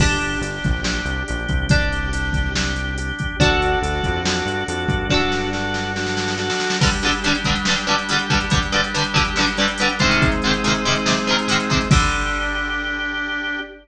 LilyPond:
<<
  \new Staff \with { instrumentName = "Acoustic Guitar (steel)" } { \time 4/4 \key g \minor \tempo 4 = 141 <d' g'>1 | <d' g'>1 | <d' fis' a'>1 | <d' fis' a'>1 |
<g, d g>8 <g, d g>8 <g, d g>8 <g, d g>8 <g, d g>8 <g, d g>8 <g, d g>8 <g, d g>8 | <g, d g>8 <g, d g>8 <g, d g>8 <g, d g>8 <g, d g>8 <g, d g>8 <g, d g>8 <aes, c ees>8~ | <aes, c ees>8 <aes, c ees>8 <aes, c ees>8 <aes, c ees>8 <aes, c ees>8 <aes, c ees>8 <aes, c ees>8 <aes, c ees>8 | <d g>1 | }
  \new Staff \with { instrumentName = "Drawbar Organ" } { \time 4/4 \key g \minor <d' g'>4 <d' g'>4 <d' g'>4 <d' g'>4 | <d' g'>4 <d' g'>4 <d' g'>4 <d' g'>4 | <d' fis' a'>4 <d' fis' a'>4 <d' fis' a'>4 <d' fis' a'>4 | <d' fis' a'>4 <d' fis' a'>4 <d' fis' a'>4 <d' fis' a'>4 |
<g d' g'>1~ | <g d' g'>1 | <aes c' ees'>1 | <d' g'>1 | }
  \new Staff \with { instrumentName = "Synth Bass 1" } { \clef bass \time 4/4 \key g \minor g,,4 g,,8 bes,,4 c,8 bes,,8 c,8~ | c,1 | d,4 d,8 f,4 g,8 f,8 g,8~ | g,1 |
r1 | r1 | r1 | r1 | }
  \new DrumStaff \with { instrumentName = "Drums" } \drummode { \time 4/4 <cymc bd>8 hh8 hh8 <hh bd>8 sn8 hh8 hh8 <hh bd>8 | <hh bd>8 hh8 hh8 <hh bd>8 sn8 hh8 hh8 <hh bd>8 | <hh bd>8 hh8 hh8 <hh bd>8 sn8 hh8 hh8 <hh bd>8 | <bd sn>8 sn8 sn8 sn8 sn16 sn16 sn16 sn16 sn16 sn16 sn16 sn16 |
<cymc bd>16 hh16 hh16 hh16 hh16 hh16 <hh bd>16 hh16 sn16 hh16 hh16 hh16 hh16 hh16 <hh bd>16 hh16 | <hh bd>16 hh16 hh16 hh16 hh16 hh16 <hh bd>16 hh16 sn16 hh16 hh16 hh16 hh16 hh16 <hh bd>16 hh16 | <hh bd>16 hh16 hh16 hh16 hh16 hh16 hh16 hh16 sn16 hh16 hh16 hh16 hh16 hh16 <hh bd>16 hh16 | <cymc bd>4 r4 r4 r4 | }
>>